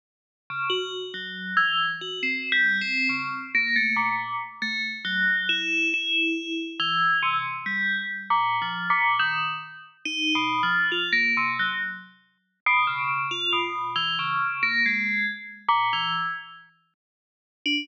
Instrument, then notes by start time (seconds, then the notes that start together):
tubular bells
0.50 C#3
0.70 F#4
1.14 F#3
1.57 E3
2.01 F#4
2.23 C4
2.52 G3
2.81 C4
3.09 C#3
3.55 A#3
3.76 A3
3.96 A#2
4.62 A3
5.05 F#3
5.49 E4
5.94 E4
6.80 E3
7.23 C3
7.66 G3
8.30 A#2
8.62 F3
8.90 A#2
9.19 D#3
10.05 D#4
10.35 B2
10.63 F3
10.92 F4
11.12 A#3
11.37 C3
11.59 F#3
12.66 B2
12.87 C#3
13.31 F4
13.53 B2
13.96 E3
14.19 C#3
14.63 A#3
14.86 G#3
15.68 A#2
15.93 E3
17.66 D4